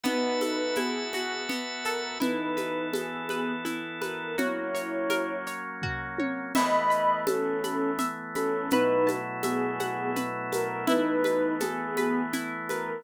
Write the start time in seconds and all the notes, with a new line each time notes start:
0.04 B3 D#4 F#4 B4 E5 A5, low conga, shaker
0.41 A4, high conga, shaker
0.75 B3 E4 G#4, high conga, shaker
1.13 F#4, high conga, shaker
1.49 B3, low conga, shaker
1.84 A4 A#4, shaker
2.20 E3 B3 D#4 E4 A4 B4, low conga, shaker
2.57 B4, high conga, shaker
2.93 B3 G#4 A4, high conga, shaker
3.29 B4, high conga, shaker
3.65 E4, low conga, shaker
4.02 A#4 B4, high conga, shaker
4.38 F#3 A#3 C#4 E4 F#4 C#5, low conga, shaker
4.75 C#5, shaker
5.10 A#4, high conga, shaker
5.47 C#5, shaker
5.82 F#4, kick, floor tom
6.19 C#5, high tom
6.55 E3 A3 B3 D#5 E5 B5, crash, low conga, shaker
6.90 B5, shaker
7.27 C#4 A4 A5, high conga, shaker
7.64 B5, high conga, shaker
7.99 E5, low conga, shaker
8.35 C#4 A4 B5, high conga, shaker
8.70 B2 F#3 A3 D#4 E4 B4, low conga, shaker
9.07 A5, high conga, shaker
9.43 B3 G#4 E5, high conga, shaker
9.80 F#5, high conga, shaker
10.16 B4, low conga, shaker
10.52 A#4 A5, high conga, shaker
10.87 E3 A3 B3 D#4 E4 B4, low conga, shaker
11.24 B4, high conga, shaker
11.60 B3 G#4 A4, high conga, shaker
11.97 B4, high conga, shaker
12.33 E4, low conga, shaker
12.69 A#4 B4, high conga, shaker